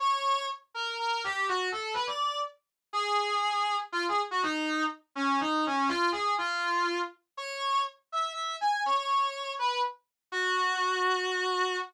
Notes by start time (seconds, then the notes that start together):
0.00 C#5
0.74 A#4
0.99 A#4
1.24 G4
1.48 F#4
1.72 A4
1.94 B4
2.07 D5
2.93 G#4
3.92 F4
4.09 G#4
4.31 F#4
4.43 D#4
5.15 C#4
5.40 D#4
5.66 C#4
5.88 F4
6.12 G#4
6.38 F4
7.37 C#5
8.12 E5
8.33 E5
8.61 G#5
8.86 C#5
8.96 C#5
9.59 B4
10.32 F#4